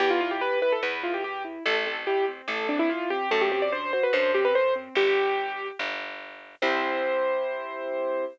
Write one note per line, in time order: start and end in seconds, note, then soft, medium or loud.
0.00 0.76 E2 loud
0.00 0.19 B3 loud
0.00 0.10 G4 loud
0.10 0.20 F4 loud
0.21 0.39 E4 medium
0.21 0.31 F4 loud
0.31 0.41 G4 loud
0.41 0.60 G4 medium
0.41 0.59 B4 loud
0.62 0.80 E4 medium
0.62 0.72 B4 loud
0.72 0.82 A4 loud
0.83 1.59 E2 medium
0.83 1.01 B3 medium
0.83 1.01 B4 medium
1.03 1.22 E4 medium
1.03 1.13 F4 medium
1.14 1.24 G4 medium
1.24 1.43 G4 loud
1.24 1.43 G4 medium
1.45 1.63 E4 medium
1.66 2.42 A1 loud
1.66 1.84 A3 loud
1.66 1.75 A4 loud
1.86 2.05 C4 medium
1.86 1.96 A4 loud
2.07 2.26 E4 medium
2.07 2.25 G4 loud
2.28 2.47 C4 medium
2.48 3.24 A1 medium
2.48 2.68 A3 medium
2.48 2.67 A4 medium
2.69 2.87 C4 medium
2.69 2.79 D4 loud
2.79 2.89 E4 loud
2.89 3.08 E4 medium
2.89 3.09 F4 loud
3.10 3.29 C4 medium
3.10 3.30 G4 loud
3.31 4.07 F#2 loud
3.31 3.49 A3 loud
3.31 3.41 A4 loud
3.41 3.51 G4 loud
3.51 3.70 C4 medium
3.51 3.62 G4 loud
3.62 3.72 D5 loud
3.72 3.91 D4 medium
3.72 3.92 C5 loud
3.93 4.12 F#4 medium
3.93 4.03 C5 loud
4.03 4.13 B4 medium
4.13 4.89 F#2 loud
4.13 4.32 D4 medium
4.13 4.32 C5 loud
4.34 4.53 C4 medium
4.34 4.44 G4 loud
4.45 4.55 B4 loud
4.55 4.74 A3 medium
4.55 4.74 C5 loud
4.76 4.94 C4 medium
4.95 5.72 G1 loud
4.95 5.67 G4 loud
5.79 6.56 G1 loud
6.62 8.25 C2 loud
6.62 8.25 C4 loud
6.62 8.25 E4 loud
6.62 8.25 G4 loud
6.62 8.25 C5 loud